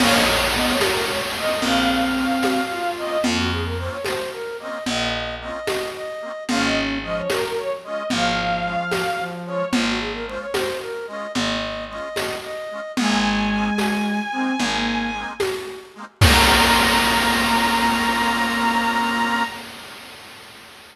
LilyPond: <<
  \new Staff \with { instrumentName = "Violin" } { \time 12/8 \key bes \minor \tempo 4. = 74 f''16 ees''16 r8 ees''16 des''16 bes'8 des''16 r16 ees''8 f''2~ f''8 ees''8 | r1. | f''16 ees''16 r8 ees''16 des''16 bes'8 des''16 r16 ees''8 f''2~ f''8 des''8 | r1. |
aes''1~ aes''4 r4 | bes''1. | }
  \new Staff \with { instrumentName = "Flute" } { \time 12/8 \key bes \minor des''4 b8 r4. c'2 f'4 | f'16 ges'16 aes'16 bes'16 c''16 des''16 c''8 bes'8 ees''8 ees''4 ees''4 ees''4 | des'4 f8 r4. f2 f4 | f'16 ges'16 aes'16 bes'16 c''16 des''16 c''8 bes'8 ees''8 ees''4 ees''4 ees''4 |
aes2~ aes8 c'8 bes4 r2 | bes1. | }
  \new Staff \with { instrumentName = "Accordion" } { \time 12/8 \key bes \minor <bes c' des' f'>4 <bes c' des' f'>4. <bes c' des' f'>4. <bes c' des' f'>4. <bes c' des' f'>8~ | <bes c' des' f'>4 <bes c' des' f'>4. <bes c' des' f'>4. <bes c' des' f'>4. <bes c' des' f'>8 | <aes des' f'>4 <aes des' f'>4. <aes des' f'>4. <aes des' f'>4. <aes des' f'>8~ | <aes des' f'>4 <aes des' f'>4. <aes des' f'>4. <aes des' f'>4. <aes des' f'>8 |
<aes bes c' ees'>4 <aes bes c' ees'>4. <aes bes c' ees'>4. <aes bes c' ees'>4. <aes bes c' ees'>8 | <bes c' des' f'>1. | }
  \new Staff \with { instrumentName = "Electric Bass (finger)" } { \clef bass \time 12/8 \key bes \minor bes,,4. r4. bes,,4. r4. | f,4. r4. bes,,4. r4. | aes,,4. r4. aes,,4. r4. | aes,,4. r4. aes,,4. r4. |
aes,,4. r4. aes,,4. r4. | bes,,1. | }
  \new DrumStaff \with { instrumentName = "Drums" } \drummode { \time 12/8 <cgl cymc>4. <cgho tamb>4. cgl4. <cgho tamb>4. | cgl4. <cgho tamb>4. cgl4. <cgho tamb>4. | cgl4. <cgho tamb>4. cgl4. <cgho tamb>4. | cgl4. <cgho tamb>4. cgl4. <cgho tamb>4. |
cgl4. <cgho tamb>4. cgl4. <cgho tamb>4. | <cymc bd>4. r4. r4. r4. | }
>>